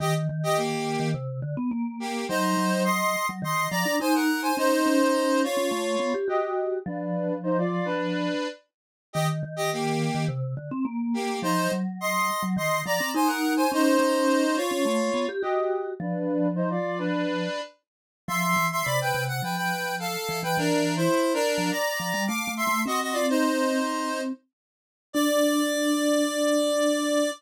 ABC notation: X:1
M:4/4
L:1/16
Q:1/4=105
K:Cdor
V:1 name="Lead 1 (square)"
[Ge] z2 [Ge] [B,G]4 z6 [B,G]2 | [Ec]4 [ec']3 z [ec']2 [db]2 [c_a] [B_g]2 [ca] | [Ec]6 [F_d]6 [Ge]4 | [D=B]4 [Ec] [Fd]2 [DB]5 z4 |
[Ge] z2 [Ge] [B,G]4 z6 [B,G]2 | [Ec]2 z2 [ec']3 z [ec']2 [db]2 [c_a] [B_g]2 [ca] | [Ec]6 [F_d]6 [Ge]4 | [D=B]4 [Ec] [Fd]2 [DB]5 z4 |
[K:Ddor] [ec']3 [ec'] [db] [Bg]2 ^f [Bg] [Bg]3 [A=f]3 [Bg] | (3[D_B]4 [Ec]4 [DB]4 [d_b]4 [fd']2 [ec']2 | [_G_e] [Ge] [Fd] [_Ec]7 z6 | d16 |]
V:2 name="Vibraphone"
E,2 E,5 E, C,2 D, _C B,4 | _G,2 G,5 G, E,2 F, D E4 | _D2 D5 D A,2 =B, G ^F4 | F,12 z4 |
E,2 E,5 E, C,2 D, C B,4 | F,2 _G,5 G, E,2 F, C E4 | _D2 D5 D A,2 =B, G ^F4 | F,12 z4 |
[K:Ddor] F,2 E,2 C,2 C,2 F,6 E, E, | E,4 z3 F, z2 F, G, (3A,2 A,2 A,2 | C12 z4 | D16 |]